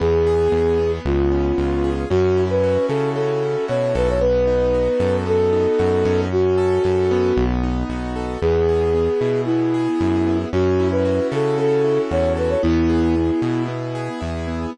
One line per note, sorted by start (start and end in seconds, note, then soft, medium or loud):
0.00 0.48 E2 medium
0.00 0.52 B3 medium
0.00 0.92 G#4 medium
0.27 1.02 G#4 medium
0.52 0.99 E2 medium
0.52 0.79 B3 medium
0.79 2.05 B3 medium
1.05 1.53 C#2 medium
1.05 1.90 F4 medium
1.31 2.06 C#4 medium
1.58 2.05 C#2 medium
1.58 2.08 F4 medium
1.84 2.09 G#4 medium
2.10 2.78 F#2 medium
2.10 3.15 C#4 medium
2.10 2.44 F#4 medium
2.37 3.42 E4 medium
2.50 2.86 B4 medium
2.63 3.68 F#4 medium
2.88 3.56 C#3 medium
2.88 3.10 A4 medium
2.88 3.94 A4 medium
3.15 4.16 C#4 medium
3.15 3.65 A4 medium
3.43 4.18 E4 medium
3.68 3.94 B2 medium
3.68 4.18 F#4 medium
3.68 3.94 C#5 medium
3.95 4.89 B1 medium
3.95 4.20 A4 medium
3.95 4.08 B4 medium
4.09 4.22 C#5 medium
4.21 5.26 B3 medium
4.21 5.16 B4 medium
4.47 5.52 D#4 medium
4.74 5.79 F#4 medium
5.00 5.67 F#2 medium
5.00 6.25 A4 medium
5.26 6.26 B3 medium
5.26 6.20 A4 medium
5.53 6.28 D#4 medium
5.79 6.04 F#2 medium
5.79 6.29 F#4 medium
6.05 6.79 F#2 medium
6.05 6.83 C#4 medium
6.32 7.44 F#4 medium
6.58 7.33 A4 medium
6.84 7.32 F#2 medium
6.84 7.34 C#4 medium
7.11 8.37 B3 medium
7.37 7.84 B1 medium
7.63 8.38 D#4 medium
7.89 8.37 B1 medium
7.89 8.40 F#4 medium
8.16 8.41 A4 medium
8.41 9.09 E2 medium
8.41 8.94 B3 medium
8.41 9.41 G#4 medium
8.69 9.73 G#4 medium
8.94 9.47 B3 medium
9.21 9.88 B2 medium
9.21 10.00 E4 medium
9.45 10.26 B3 medium
9.45 10.37 E4 medium
9.74 10.49 G#4 medium
10.00 10.45 F#2 medium
10.00 10.50 E4 medium
10.27 10.52 B3 medium
10.53 11.20 F#2 medium
10.53 11.58 C#4 medium
10.53 10.88 F#4 medium
10.79 11.84 E4 medium
10.91 11.27 B4 medium
11.05 12.11 F#4 medium
11.32 11.99 C#3 medium
11.32 12.36 A4 medium
11.32 11.58 A4 medium
11.58 12.58 C#4 medium
11.58 12.01 A4 medium
11.84 12.59 E4 medium
12.11 12.56 E2 medium
12.11 12.61 F#4 medium
12.11 12.33 C#5 medium
12.37 12.62 A4 medium
12.37 12.50 B4 medium
12.49 12.62 C#5 medium
12.62 13.31 E2 medium
12.62 13.15 B3 loud
12.62 13.63 E4 medium
12.89 13.95 G#4 medium
13.16 13.68 B3 medium
13.42 14.09 B2 medium
13.42 14.20 E4 medium
13.68 14.47 B3 medium
13.95 14.70 G#4 medium
14.21 14.66 E2 medium
14.21 14.71 E4 medium
14.47 14.72 B3 medium